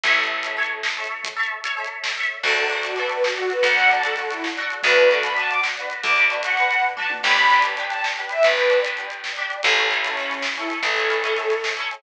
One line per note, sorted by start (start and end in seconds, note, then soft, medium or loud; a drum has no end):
0.04 2.25 A1 medium
0.04 0.16 A4 medium
0.04 0.16 C#5 medium
0.04 0.16 E5 medium
0.04 kick loud
0.04 closed hi-hat loud
0.17 0.41 A4 medium
0.17 0.41 C#5 medium
0.17 0.41 E5 medium
0.24 closed hi-hat medium
0.43 0.56 A4 medium
0.43 0.56 C#5 medium
0.43 0.56 E5 medium
0.43 closed hi-hat loud
0.57 0.93 A4 medium
0.57 0.93 C#5 medium
0.57 0.93 E5 medium
0.63 closed hi-hat medium
0.83 snare loud
0.97 1.34 A4 medium
0.97 1.34 C#5 medium
0.97 1.34 E5 medium
1.04 closed hi-hat medium
1.24 kick loud
1.24 closed hi-hat loud
1.36 1.61 A4 medium
1.36 1.61 C#5 medium
1.36 1.61 E5 medium
1.43 closed hi-hat medium
1.64 1.76 A4 medium
1.64 1.76 C#5 medium
1.64 1.76 E5 medium
1.64 closed hi-hat loud
1.77 2.14 A4 medium
1.77 2.14 C#5 medium
1.77 2.14 E5 medium
1.84 closed hi-hat medium
2.04 snare loud
2.17 2.42 A4 medium
2.17 2.42 C#5 medium
2.17 2.42 E5 medium
2.23 closed hi-hat medium
2.43 3.54 D2 medium
2.43 2.55 D4 medium
2.43 2.55 F#4 medium
2.43 2.77 A4 medium
2.43 2.55 A4 medium
2.43 kick loud
2.43 crash loud
2.57 2.69 D4 medium
2.57 2.69 F#4 medium
2.57 2.69 A4 medium
2.57 closed hi-hat medium
2.70 2.83 D4 medium
2.70 2.83 F#4 medium
2.70 2.83 A4 medium
2.70 closed hi-hat medium
2.83 2.96 D4 medium
2.83 2.97 F#4 medium
2.83 2.96 F#4 medium
2.83 2.96 A4 medium
2.83 closed hi-hat loud
2.96 3.33 D4 medium
2.96 3.33 F#4 medium
2.96 3.33 A4 medium
2.96 3.09 B4 medium
2.96 closed hi-hat medium
3.09 3.22 B4 medium
3.09 closed hi-hat medium
3.24 3.48 F#4 medium
3.24 snare loud
3.36 3.73 D4 medium
3.36 3.73 F#4 medium
3.36 3.73 A4 medium
3.36 closed hi-hat medium
3.50 3.64 B4 medium
3.50 closed hi-hat medium
3.63 4.73 D2 medium
3.63 3.87 F#5 medium
3.63 kick loud
3.63 closed hi-hat loud
3.77 3.89 D4 medium
3.77 3.89 F#4 medium
3.77 3.89 A4 medium
3.77 closed hi-hat medium
3.90 4.02 D4 medium
3.90 4.02 F#4 medium
3.90 4.02 A4 medium
3.90 4.04 A5 medium
3.90 closed hi-hat medium
4.03 4.15 D4 medium
4.03 4.15 F#4 medium
4.03 4.15 A4 medium
4.03 closed hi-hat loud
4.16 4.54 D4 medium
4.16 4.54 F#4 medium
4.16 4.28 A4 medium
4.16 closed hi-hat medium
4.20 4.54 A4 medium
4.30 4.43 E4 medium
4.30 closed hi-hat medium
4.44 snare loud
4.57 4.81 D4 medium
4.57 4.81 F#4 medium
4.57 4.81 A4 medium
4.57 closed hi-hat medium
4.70 closed hi-hat medium
4.83 5.94 D2 medium
4.83 4.96 D4 medium
4.83 4.96 F#4 medium
4.83 5.08 B4 medium
4.83 4.96 B4 medium
4.83 kick loud
4.83 closed hi-hat loud
4.96 5.09 D4 medium
4.96 5.09 F#4 medium
4.96 5.09 B4 medium
4.96 closed hi-hat medium
5.10 5.22 D4 medium
5.10 5.22 F#4 medium
5.10 5.23 A4 medium
5.10 5.22 B4 medium
5.10 closed hi-hat medium
5.23 5.36 D4 medium
5.23 5.36 F#4 medium
5.23 5.36 B4 medium
5.23 5.34 B5 medium
5.23 closed hi-hat loud
5.36 5.74 D4 medium
5.36 5.74 F#4 medium
5.36 5.74 B4 medium
5.36 5.48 A5 medium
5.36 closed hi-hat medium
5.49 5.60 D6 medium
5.49 closed hi-hat medium
5.63 snare loud
5.77 6.14 D4 medium
5.77 6.14 F#4 medium
5.77 6.14 B4 medium
5.77 closed hi-hat medium
5.90 closed hi-hat medium
6.03 7.14 D2 medium
6.03 6.25 D6 medium
6.03 kick loud
6.03 closed hi-hat loud
6.16 6.29 D4 medium
6.16 6.29 F#4 medium
6.16 6.29 B4 medium
6.16 closed hi-hat medium
6.30 6.42 D4 medium
6.30 6.42 F#4 medium
6.30 6.42 B4 medium
6.30 closed hi-hat medium
6.43 6.56 D4 medium
6.43 6.56 F#4 medium
6.43 6.56 B4 medium
6.43 6.81 F#5 medium
6.43 closed hi-hat loud
6.57 6.93 D4 medium
6.57 6.93 F#4 medium
6.57 6.93 B4 medium
6.57 closed hi-hat medium
6.71 closed hi-hat medium
6.83 kick medium
6.83 floor tom medium
6.97 7.21 D4 medium
6.97 7.21 F#4 medium
6.97 7.21 B4 medium
6.97 7.09 A5 medium
6.97 mid tom medium
7.10 high tom loud
7.23 8.34 G1 medium
7.23 7.36 D4 medium
7.23 7.36 G4 medium
7.23 7.36 B4 medium
7.23 7.57 B5 medium
7.23 kick loud
7.23 crash loud
7.37 7.49 D4 medium
7.37 7.49 G4 medium
7.37 7.49 B4 medium
7.37 closed hi-hat medium
7.50 7.63 D4 medium
7.50 7.63 G4 medium
7.50 7.63 B4 medium
7.50 closed hi-hat medium
7.62 7.75 D4 medium
7.62 7.75 G4 medium
7.62 7.75 B4 medium
7.62 closed hi-hat loud
7.77 8.14 D4 medium
7.77 8.14 G4 medium
7.77 8.14 B4 medium
7.77 closed hi-hat medium
7.89 8.02 A5 medium
7.89 closed hi-hat medium
8.04 snare loud
8.16 8.54 D4 medium
8.16 8.54 G4 medium
8.16 closed hi-hat medium
8.20 8.54 B4 medium
8.29 8.44 E5 medium
8.29 closed hi-hat medium
8.43 9.55 G1 medium
8.43 8.78 B4 medium
8.43 kick loud
8.43 closed hi-hat loud
8.57 8.70 D4 medium
8.57 8.70 G4 medium
8.57 8.70 B4 medium
8.57 closed hi-hat medium
8.70 8.82 D4 medium
8.70 8.82 G4 medium
8.70 8.82 B4 medium
8.70 closed hi-hat medium
8.84 8.96 D4 medium
8.84 8.96 G4 medium
8.84 8.96 B4 medium
8.84 closed hi-hat loud
8.97 9.34 D4 medium
8.97 9.34 G4 medium
8.97 9.34 B4 medium
8.97 closed hi-hat medium
9.10 closed hi-hat medium
9.24 snare loud
9.36 9.62 D4 medium
9.36 9.62 G4 medium
9.36 9.62 B4 medium
9.36 closed hi-hat medium
9.50 closed hi-hat medium
9.63 10.75 A1 medium
9.63 9.76 C#4 medium
9.63 9.76 E4 medium
9.63 9.85 A4 medium
9.63 9.76 A4 medium
9.63 kick loud
9.63 closed hi-hat loud
9.76 9.89 C#4 medium
9.76 9.89 E4 medium
9.76 9.89 A4 medium
9.76 closed hi-hat medium
9.90 10.02 C#4 medium
9.90 10.02 E4 medium
9.90 10.02 A4 medium
9.90 closed hi-hat medium
10.04 10.16 C#4 medium
10.04 10.42 C#4 medium
10.04 10.16 E4 medium
10.04 10.16 A4 medium
10.04 closed hi-hat loud
10.17 10.54 C#4 medium
10.17 10.54 E4 medium
10.17 10.54 A4 medium
10.17 closed hi-hat medium
10.31 closed hi-hat medium
10.42 snare loud
10.56 10.94 C#4 medium
10.56 10.68 E4 medium
10.56 10.94 E4 medium
10.56 closed hi-hat medium
10.60 10.94 A4 medium
10.70 closed hi-hat medium
10.82 11.93 A1 medium
10.82 11.58 A4 medium
10.82 kick loud
10.82 closed hi-hat loud
10.97 11.09 C#4 medium
10.97 11.09 E4 medium
10.97 11.09 A4 medium
10.97 closed hi-hat medium
11.10 11.22 C#4 medium
11.10 11.22 E4 medium
11.10 11.22 A4 medium
11.10 closed hi-hat medium
11.23 11.36 C#4 medium
11.23 11.36 E4 medium
11.23 11.36 A4 medium
11.23 closed hi-hat loud
11.36 11.73 C#4 medium
11.36 11.73 E4 medium
11.36 11.73 A4 medium
11.36 closed hi-hat medium
11.50 closed hi-hat medium
11.64 snare loud
11.77 12.01 C#4 medium
11.77 12.01 E4 medium
11.77 12.01 A4 medium
11.77 closed hi-hat medium
11.91 closed hi-hat medium